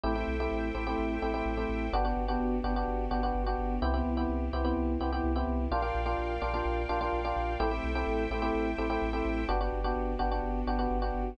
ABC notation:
X:1
M:4/4
L:1/16
Q:1/4=127
K:G
V:1 name="Electric Piano 1"
[A,CEG] [A,CEG]2 [A,CEG]3 [A,CEG] [A,CEG]3 [A,CEG] [A,CEG]2 [A,CEG]3 | [B,DFG] [B,DFG]2 [B,DFG]3 [B,DFG] [B,DFG]3 [B,DFG] [B,DFG]2 [B,DFG]3 | [B,CEG] [B,CEG]2 [B,CEG]3 [B,CEG] [B,CEG]3 [B,CEG] [B,CEG]2 [B,CEG]3 | [_B,D=FG] [B,DFG]2 [B,DFG]3 [B,DFG] [B,DFG]3 [B,DFG] [B,DFG]2 [B,DFG]3 |
[A,CEG] [A,CEG]2 [A,CEG]3 [A,CEG] [A,CEG]3 [A,CEG] [A,CEG]2 [A,CEG]3 | [B,DFG] [B,DFG]2 [B,DFG]3 [B,DFG] [B,DFG]3 [B,DFG] [B,DFG]2 [B,DFG]3 |]
V:2 name="Synth Bass 2" clef=bass
A,,,2 B,,,2 A,,,2 A,,,2 A,,,2 A,,,2 A,,,2 A,,,2 | G,,,2 G,,,2 G,,,2 G,,,2 G,,,2 G,,,2 G,,,2 G,,,2 | C,,2 C,,2 C,,2 C,,2 C,,2 C,,2 C,,2 C,,2 | _B,,,2 B,,,2 B,,,2 B,,,2 B,,,2 B,,,2 B,,,2 B,,,2 |
A,,,2 B,,,2 A,,,2 A,,,2 A,,,2 A,,,2 A,,,2 A,,,2 | G,,,2 G,,,2 G,,,2 G,,,2 G,,,2 G,,,2 G,,,2 G,,,2 |]
V:3 name="String Ensemble 1"
[Aceg]16 | [B,DFG]16 | [B,CEG]16 | [_Bd=fg]16 |
[Aceg]16 | [B,DFG]16 |]